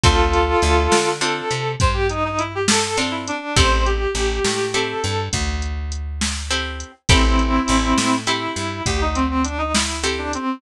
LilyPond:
<<
  \new Staff \with { instrumentName = "Clarinet" } { \time 12/8 \key a \minor \tempo 4. = 68 <f' a'>2 a'4 c''16 g'16 ees'16 dis'16 e'16 g'16 a'8 r16 e'16 d'8 | c''8 g'4. a'4 r2. | <c' e'>2 e'4 g'16 ees'16 c'16 c'16 d'16 dis'16 e'8 r16 d'16 c'8 | }
  \new Staff \with { instrumentName = "Acoustic Guitar (steel)" } { \time 12/8 \key a \minor <c' d' f' a'>2 <c' d' f' a'>2. <c' d' f' a'>4 | <c' e' g' a'>2 <c' e' g' a'>2. <c' e' g' a'>4 | <c' e' g' a'>2 <c' e' g' a'>2. <c' e' g' a'>4 | }
  \new Staff \with { instrumentName = "Electric Bass (finger)" } { \clef bass \time 12/8 \key a \minor d,4 d,8 d4 c8 g,2. | a,,4 a,,8 a,4 g,8 d,2. | a,,4 a,,8 a,4 g,8 d,2. | }
  \new DrumStaff \with { instrumentName = "Drums" } \drummode { \time 12/8 <hh bd>8 hh8 hh8 sn8 hh8 hh8 <hh bd>8 hh8 hh8 sn8 hh8 hh8 | <hh bd>8 hh8 hh8 sn8 hh8 hh8 <hh bd>8 hh8 hh8 sn8 hh8 hh8 | <hh bd>8 hh8 hh8 sn8 hh8 hh8 <hh bd>8 hh8 hh8 sn8 hh8 hh8 | }
>>